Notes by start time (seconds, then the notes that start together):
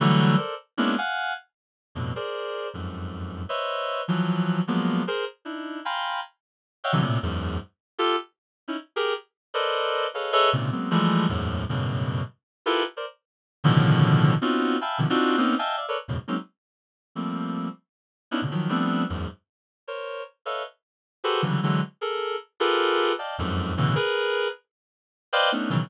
0.00 D3 E3 F#3 G3 A3
0.37 A4 A#4 C5 D5
0.77 G#3 A#3 B3 C#4 D4 E4
0.98 F5 F#5 G#5
1.95 F2 G2 A2 B2
2.16 G#4 A#4 C5 D5
2.74 F2 F#2 G#2
3.49 B4 C5 C#5 D#5 E5
4.08 E3 F3 F#3
4.67 F3 F#3 G#3 A#3 B3
5.07 G#4 A#4 C5
5.45 D4 D#4 E4
5.85 F5 G5 G#5 A#5 B5 C6
6.84 C#5 D#5 E5 F5 F#5 G5
6.92 C3 D3 E3 F#3
7.01 A2 A#2 C3
7.22 E2 F#2 G#2
7.98 F4 G4 A4
8.68 C#4 D#4 E4
8.96 G4 G#4 A#4
9.54 A4 A#4 B4 C5 D5 D#5
10.14 G#4 A4 B4 C#5 D#5 F5
10.32 G#4 A4 B4 C#5 D#5 E5
10.53 G#2 A#2 C3 C#3
10.72 F#3 G#3 A#3 B3 C4
10.91 E3 F3 G3 G#3 A3
11.29 E2 F#2 G#2 A2
11.69 F#2 G2 A2 B2 C#3
12.66 E4 F4 G4 A4 A#4 B4
12.97 A#4 C5 D5
13.64 A2 B2 C#3 D3 D#3 F3
14.42 B3 C4 C#4 D#4 F4 F#4
14.81 E5 F5 G5 G#5 A5 B5
14.98 B2 C3 D3 D#3 F3
15.10 C4 D4 D#4 F4 F#4
15.37 A#3 B3 C4 C#4 D#4
15.59 D#5 E5 F5 G5 G#5 A5
15.77 D5 E5 F5
15.88 A4 A#4 B4 C#5 D5
16.08 E2 F#2 G#2 A2 B2 C#3
16.28 F#3 G#3 A#3 C4 C#4 D#4
17.15 F3 G3 A3 A#3 C4
18.31 B3 C#4 D4 D#4 E4
18.42 A2 A#2 B2 C#3 D3
18.51 D#3 F3 F#3
18.69 F3 G3 A3 B3 C4 D4
19.09 E2 F#2 G#2
19.87 A#4 C5 C#5
20.45 A4 B4 C#5 D#5 E5 F5
21.24 F#4 G4 G#4 A4 B4 C5
21.42 C#3 D3 E3 F#3 G3
21.63 D3 E3 F#3 G#3
22.01 G#4 A4 A#4
22.60 F4 G4 G#4 A4 A#4 B4
23.19 D5 D#5 F5 G5 A5
23.38 F2 F#2 G#2
23.77 G2 A2 B2 C#3 D3 E3
23.95 G#4 A#4 B4
25.33 B4 C5 D5 D#5 F5 G5
25.52 A3 B3 C#4 D4 D#4
25.70 B2 C#3 D#3 E3 F#3